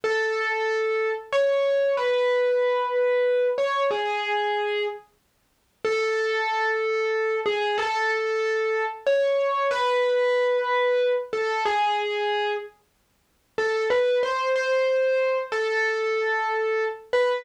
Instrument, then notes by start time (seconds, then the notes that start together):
acoustic grand piano
0.04 A4
1.33 C#5
1.97 B4
3.58 C#5
3.91 G#4
5.85 A4
7.46 G#4
7.78 A4
9.07 C#5
9.71 B4
11.33 A4
11.65 G#4
13.58 A4
13.90 B4
14.23 C5
14.56 C5
15.52 A4
17.13 B4